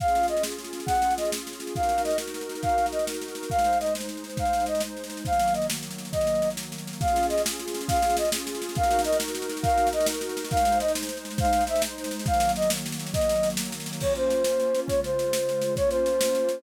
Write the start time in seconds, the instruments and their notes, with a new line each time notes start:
0.00 pad 2 (warm) C#4 F4 G#4, flute F5, kick, snare
0.08 snare
0.15 snare
0.23 snare
0.28 flute D#5, snare
0.37 snare
0.43 snare
0.51 snare
0.58 snare
0.64 snare
0.73 snare
0.80 snare
0.86 flute F#5, kick, snare
0.95 snare
1.02 snare
1.11 snare
1.17 flute D#5, snare
1.25 snare
1.32 snare
1.37 snare
1.47 snare
1.53 snare
1.60 snare
1.67 snare
1.74 pad 2 (warm) D#4 F#4 A#4, flute F5, kick, snare
1.83 snare
1.89 snare
1.98 snare
2.04 flute D#5, snare
2.11 snare
2.18 snare
2.27 snare
2.34 snare
2.41 snare
2.49 snare
2.55 snare
2.63 flute F5, kick, snare
2.69 snare
2.78 snare
2.86 snare
2.92 flute D#5, snare
2.99 snare
3.07 snare
3.14 snare
3.21 snare
3.28 snare
3.35 snare
3.43 snare
3.50 pad 2 (warm) G#3 D#4 C5, flute F5, kick, snare
3.59 snare
3.64 snare
3.73 snare
3.80 flute D#5, snare
3.86 snare
3.95 snare
4.00 snare
4.09 snare
4.17 snare
4.24 snare
4.30 snare
4.37 flute F5, kick, snare
4.45 snare
4.53 snare
4.60 snare
4.66 flute D#5, snare
4.75 snare
4.80 snare
4.97 snare
5.04 snare
5.10 snare
5.17 snare
5.25 pad 2 (warm) D#3 F#3 A#3, flute F5, kick, snare
5.33 snare
5.39 snare
5.48 snare
5.54 flute D#5, snare
5.62 snare
5.70 snare
5.77 snare
5.83 snare
5.91 snare
5.98 snare
6.05 snare
6.12 flute D#5, kick, snare
6.21 snare
6.27 snare
6.35 snare
6.42 snare
6.50 snare
6.57 snare
6.63 snare
6.72 snare
6.78 snare
6.87 snare
6.93 snare
6.99 pad 2 (warm) C#4 F4 G#4, flute F5, kick, snare
7.08 snare
7.16 snare
7.23 snare
7.29 flute D#5, snare
7.38 snare
7.46 snare
7.51 snare
7.59 snare
7.68 snare
7.74 snare
7.81 snare
7.88 flute F5, kick, snare
7.96 snare
8.02 snare
8.10 snare
8.17 flute D#5, snare
8.25 snare
8.32 snare
8.38 snare
8.47 snare
8.55 snare
8.62 snare
8.69 snare
8.75 pad 2 (warm) D#4 F#4 A#4, flute F5, kick, snare
8.83 snare
8.91 snare
8.99 snare
9.04 flute D#5, snare
9.12 snare
9.20 snare
9.28 snare
9.35 snare
9.42 snare
9.49 snare
9.57 snare
9.63 flute F5, kick, snare
9.69 snare
9.78 snare
9.87 snare
9.93 flute D#5, snare
10.00 snare
10.06 snare
10.14 snare
10.21 snare
10.29 snare
10.37 snare
10.44 snare
10.51 pad 2 (warm) G#3 D#4 C5, flute F5, kick, snare
10.57 snare
10.65 snare
10.72 snare
10.80 flute D#5, snare
10.88 snare
10.95 snare
11.03 snare
11.09 snare
11.17 snare
11.25 snare
11.31 snare
11.38 flute F5, kick, snare
11.45 snare
11.53 snare
11.61 snare
11.67 flute E5, snare
11.76 snare
11.82 snare
11.98 snare
12.04 snare
12.11 snare
12.19 snare
12.26 pad 2 (warm) D#3 F#3 A#3, flute F5, kick, snare
12.34 snare
12.40 snare
12.49 snare
12.56 flute D#5, snare
12.62 snare
12.70 snare
12.77 snare
12.86 snare
12.92 snare
12.99 snare
13.06 snare
13.14 flute D#5, kick, snare
13.21 snare
13.29 snare
13.36 snare
13.43 snare
13.50 snare
13.57 snare
13.65 snare
13.72 snare
13.80 snare
13.86 snare
13.93 snare
14.00 pad 2 (warm) A#3 C#4 F4, flute C#5, kick, snare, crash
14.15 flute C5, snare
14.30 snare
14.44 snare
14.60 snare
14.75 snare
14.88 pad 2 (warm) C#3 G#3 F4, flute C#5, kick, snare
15.04 flute C5, snare
15.19 snare
15.33 snare
15.49 snare
15.62 snare
15.76 pad 2 (warm) A#3 C#4 F4, flute C#5, kick, snare
15.90 flute C5, snare
16.06 snare
16.21 snare
16.35 snare
16.49 snare